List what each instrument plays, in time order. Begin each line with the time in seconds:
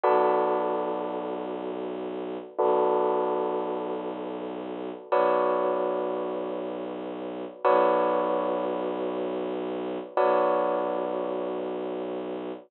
0.04 violin B1, tubular bells F#4 A4 B4 D5
2.58 violin B1, tubular bells F#4 A4 B4 D5
5.11 violin B1, tubular bells F#4 B4 C#5 D5
7.65 violin B1, tubular bells F#4 B4 C#5 D5
10.17 violin B1, tubular bells F#4 B4 C#5 D5